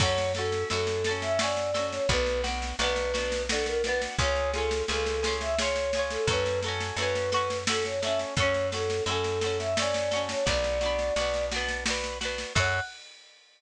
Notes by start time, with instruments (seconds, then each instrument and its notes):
0.00 electric bass (finger) F#2, acoustic guitar (steel) F#4 A4, choir aahs C#5, kick, snare, crash
0.05 acoustic guitar (steel) C#4
0.18 snare
0.35 acoustic guitar (steel) F#4 A4, choir aahs A4, snare
0.41 acoustic guitar (steel) C#4
0.52 snare
0.70 electric bass (finger) F#2, acoustic guitar (steel) F#4 A4, choir aahs A4, snare
0.75 acoustic guitar (steel) C#4
0.87 snare
1.04 acoustic guitar (steel) A4, snare
1.09 acoustic guitar (steel) C#4 F#4
1.22 choir aahs E5, snare
1.39 acoustic guitar (steel) F#4 A4, choir aahs D5, snare
1.43 acoustic guitar (steel) C#4
1.57 snare
1.74 acoustic guitar (steel) F#4 A4, snare
1.78 acoustic guitar (steel) C#4
1.92 choir aahs C#5, snare
2.09 electric bass (finger) B1, acoustic guitar (steel) D4 F#4, choir aahs B4, kick, snare
2.13 acoustic guitar (steel) B3
2.26 snare
2.44 acoustic guitar (steel) D4 F#4, snare
2.48 acoustic guitar (steel) B3
2.62 snare
2.79 electric bass (finger) B1, acoustic guitar (steel) D4 F#4, choir aahs B4, snare
2.83 acoustic guitar (steel) B3
2.96 snare
3.14 acoustic guitar (steel) D4 F#4, snare
3.18 acoustic guitar (steel) B3
3.32 snare
3.49 acoustic guitar (steel) D4 F#4, choir aahs A4, snare
3.54 acoustic guitar (steel) B3
3.66 choir aahs A#4, snare
3.84 acoustic guitar (steel) D4 F#4, choir aahs B4, snare
3.89 acoustic guitar (steel) B3
4.01 snare
4.18 electric bass (finger) C#2, acoustic guitar (steel) F4 G#4, choir aahs C#5, kick, snare
4.24 acoustic guitar (steel) C#4
4.36 snare
4.53 acoustic guitar (steel) F4 G#4, choir aahs A4, snare
4.58 acoustic guitar (steel) C#4
4.71 snare
4.88 electric bass (finger) C#2, acoustic guitar (steel) F4 G#4, choir aahs A4, snare
4.93 acoustic guitar (steel) C#4
5.06 snare
5.23 acoustic guitar (steel) F4 G#4, snare
5.27 acoustic guitar (steel) C#4
5.41 choir aahs E5, snare
5.58 acoustic guitar (steel) F4 G#4, choir aahs C#5, snare
5.64 acoustic guitar (steel) C#4
5.76 snare
5.93 acoustic guitar (steel) F4 G#4, snare
5.99 acoustic guitar (steel) C#4
6.10 choir aahs A4, snare
6.27 electric bass (finger) F#2, acoustic guitar (steel) F#4 A4, choir aahs B4, kick, snare
6.33 acoustic guitar (steel) C#4
6.46 snare
6.62 acoustic guitar (steel) F#4 A4, snare
6.68 acoustic guitar (steel) C#4
6.80 snare
6.97 electric bass (finger) F#2, acoustic guitar (steel) F#4 A4, choir aahs B4, snare
7.02 acoustic guitar (steel) C#4
7.15 snare
7.32 acoustic guitar (steel) F#4 A4, snare
7.36 acoustic guitar (steel) C#4
7.50 snare
7.67 acoustic guitar (steel) F#4 A4, choir aahs A4, snare
7.72 acoustic guitar (steel) C#4
7.85 choir aahs C#5, snare
8.02 acoustic guitar (steel) F#4 A4, choir aahs E5, snare
8.07 acoustic guitar (steel) C#4
8.19 snare
8.36 electric bass (finger) F#2, acoustic guitar (steel) F#4 A4, choir aahs C#5, kick, snare
8.42 acoustic guitar (steel) C#4
8.54 snare
8.72 acoustic guitar (steel) F#4 A4, choir aahs A4, snare
8.76 acoustic guitar (steel) C#4
8.90 snare
9.06 electric bass (finger) F#2, acoustic guitar (steel) F#4 A4, choir aahs A4, snare
9.11 acoustic guitar (steel) C#4
9.24 snare
9.41 acoustic guitar (steel) F#4 A4, snare
9.46 acoustic guitar (steel) C#4
9.59 choir aahs E5, snare
9.77 acoustic guitar (steel) F#4 A4, choir aahs D5, snare
9.82 acoustic guitar (steel) C#4
9.94 snare
10.11 acoustic guitar (steel) F#4 A4, snare
10.15 acoustic guitar (steel) C#4
10.29 choir aahs C#5, snare
10.46 electric bass (finger) B1, acoustic guitar (steel) D4 F#4, choir aahs D5, kick, snare
10.50 acoustic guitar (steel) B3
10.64 snare
10.81 acoustic guitar (steel) D4 F#4, snare
10.85 acoustic guitar (steel) B3
10.99 snare
11.16 electric bass (finger) B1, acoustic guitar (steel) D4 F#4, snare
11.21 acoustic guitar (steel) B3
11.34 snare
11.51 acoustic guitar (steel) D4 F#4, snare
11.56 acoustic guitar (steel) B3
11.68 snare
11.86 acoustic guitar (steel) D4 F#4, snare
11.90 acoustic guitar (steel) B3
12.04 snare
12.21 acoustic guitar (steel) D4 F#4, snare
12.25 acoustic guitar (steel) B3
12.38 snare
12.55 electric bass (finger) F#2, acoustic guitar (steel) F#4 A4, choir aahs F#5, kick, crash
12.60 acoustic guitar (steel) C#4